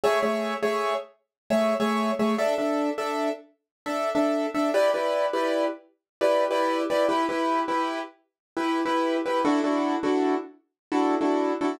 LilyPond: \new Staff { \time 12/8 \key e \dorian \tempo 4. = 102 <a gis' cis'' e''>8 <a gis' cis'' e''>4 <a gis' cis'' e''>2~ <a gis' cis'' e''>16 <a gis' cis'' e''>8. <a gis' cis'' e''>4 <a gis' cis'' e''>8 | <d' a' e''>8 <d' a' e''>4 <d' a' e''>2~ <d' a' e''>16 <d' a' e''>8. <d' a' e''>4 <d' a' e''>8 | <e' g' b' d''>8 <e' g' b' d''>4 <e' g' b' d''>2~ <e' g' b' d''>16 <e' g' b' d''>8. <e' g' b' d''>4 <e' g' b' d''>8 | <e' g' b'>8 <e' g' b'>4 <e' g' b'>2~ <e' g' b'>16 <e' g' b'>8. <e' g' b'>4 <e' g' b'>8 |
<d' e' fis' a'>8 <d' e' fis' a'>4 <d' e' fis' a'>2~ <d' e' fis' a'>16 <d' e' fis' a'>8. <d' e' fis' a'>4 <d' e' fis' a'>8 | }